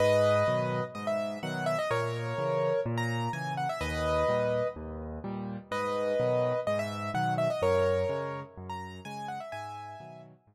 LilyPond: <<
  \new Staff \with { instrumentName = "Acoustic Grand Piano" } { \time 4/4 \key gis \minor \tempo 4 = 126 <b' dis''>2 dis''16 e''8. fis''8 e''16 dis''16 | <ais' cis''>2 r16 ais''8. gis''8 fis''16 e''16 | <b' dis''>2 r2 | <b' dis''>2 dis''16 e''8. fis''8 e''16 dis''16 |
<ais' cis''>2 r16 ais''8. gis''8 fis''16 e''16 | <e'' gis''>4. r2 r8 | }
  \new Staff \with { instrumentName = "Acoustic Grand Piano" } { \clef bass \time 4/4 \key gis \minor gis,4 <b, dis fis>4 gis,4 <b, dis fis>4 | ais,4 <cis e>4 ais,4 <cis e>4 | dis,4 <ais, g>4 dis,4 <ais, g>4 | gis,4 <b, dis fis>4 gis,4 <b, dis fis>4 |
fis,4 <cis gis>4 fis,4 <cis gis>4 | gis,4 <b, dis fis>4 gis,4 r4 | }
>>